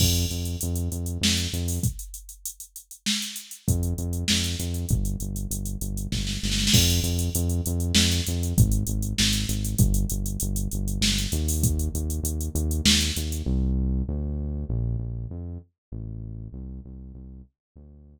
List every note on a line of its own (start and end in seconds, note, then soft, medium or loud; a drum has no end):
0.00 0.26 F2 loud
0.00 kick loud
0.00 crash loud
0.15 closed hi-hat medium
0.30 0.56 F2 medium
0.30 closed hi-hat medium
0.45 closed hi-hat medium
0.61 0.89 F2 medium
0.61 closed hi-hat loud
0.76 closed hi-hat medium
0.92 1.18 F2 medium
0.92 closed hi-hat medium
1.06 closed hi-hat medium
1.21 1.47 F2 medium
1.21 snare loud
1.37 closed hi-hat medium
1.53 1.79 F2 medium
1.53 closed hi-hat medium
1.68 open hi-hat medium
1.83 kick loud
1.83 closed hi-hat loud
1.99 closed hi-hat medium
2.14 closed hi-hat medium
2.29 closed hi-hat medium
2.45 closed hi-hat loud
2.60 closed hi-hat medium
2.76 closed hi-hat medium
2.91 closed hi-hat medium
3.06 snare loud
3.22 closed hi-hat medium
3.36 closed hi-hat medium
3.51 closed hi-hat medium
3.68 3.94 F2 medium
3.68 kick loud
3.68 closed hi-hat loud
3.83 closed hi-hat medium
3.98 4.24 F2 medium
3.98 closed hi-hat medium
4.13 closed hi-hat medium
4.28 4.56 F2 medium
4.28 snare loud
4.44 closed hi-hat medium
4.59 4.85 F2 medium
4.59 closed hi-hat medium
4.74 closed hi-hat medium
4.89 5.16 G1 medium
4.89 kick loud
4.89 closed hi-hat medium
5.05 closed hi-hat medium
5.20 5.47 G1 medium
5.20 closed hi-hat medium
5.36 closed hi-hat medium
5.51 5.77 G1 medium
5.51 closed hi-hat loud
5.65 closed hi-hat medium
5.81 6.07 G1 medium
5.81 closed hi-hat medium
5.97 closed hi-hat medium
6.12 6.38 G1 medium
6.12 kick medium
6.12 snare medium
6.27 snare medium
6.43 6.69 G1 medium
6.43 snare medium
6.52 snare medium
6.59 snare medium
6.67 snare loud
6.73 7.00 F2 loud
6.73 kick loud
6.73 crash loud
6.90 closed hi-hat medium
7.03 7.29 F2 loud
7.03 closed hi-hat medium
7.19 closed hi-hat medium
7.35 7.61 F2 loud
7.35 closed hi-hat loud
7.49 closed hi-hat medium
7.66 7.92 F2 loud
7.66 closed hi-hat loud
7.80 closed hi-hat medium
7.95 8.21 F2 loud
7.95 snare loud
8.11 closed hi-hat medium
8.27 8.54 F2 medium
8.27 closed hi-hat loud
8.43 closed hi-hat medium
8.58 8.84 G#1 loud
8.58 kick loud
8.58 closed hi-hat loud
8.72 closed hi-hat medium
8.87 9.14 G#1 loud
8.87 closed hi-hat loud
9.02 closed hi-hat medium
9.18 9.45 G#1 loud
9.18 snare loud
9.33 closed hi-hat medium
9.49 9.75 G#1 medium
9.49 closed hi-hat loud
9.65 closed hi-hat medium
9.78 10.06 G1 loud
9.78 kick loud
9.78 closed hi-hat loud
9.94 closed hi-hat loud
10.10 10.38 G1 medium
10.10 closed hi-hat loud
10.26 closed hi-hat medium
10.40 10.68 G1 medium
10.40 closed hi-hat loud
10.56 closed hi-hat loud
10.71 10.99 G1 medium
10.71 closed hi-hat medium
10.88 closed hi-hat medium
11.01 11.27 G1 medium
11.01 snare loud
11.18 closed hi-hat medium
11.32 11.89 D#2 loud
11.32 closed hi-hat loud
11.48 open hi-hat medium
11.63 kick loud
11.63 closed hi-hat loud
11.79 closed hi-hat medium
11.94 12.20 D#2 medium
11.94 closed hi-hat medium
12.10 closed hi-hat medium
12.23 12.49 D#2 medium
12.23 closed hi-hat loud
12.41 closed hi-hat medium
12.55 12.81 D#2 loud
12.55 closed hi-hat medium
12.71 closed hi-hat medium
12.85 13.11 D#2 loud
12.85 snare loud
13.01 closed hi-hat medium
13.16 13.42 D#2 medium
13.16 closed hi-hat medium
13.32 closed hi-hat medium
13.46 14.03 C2 loud
14.08 14.65 D2 loud
14.69 14.97 A#1 loud
14.99 15.27 A#1 medium
15.30 15.58 F2 medium
15.92 16.48 A1 loud
16.53 16.80 C2 loud
16.85 17.12 C2 medium
17.14 17.42 C2 medium
17.76 18.19 D2 loud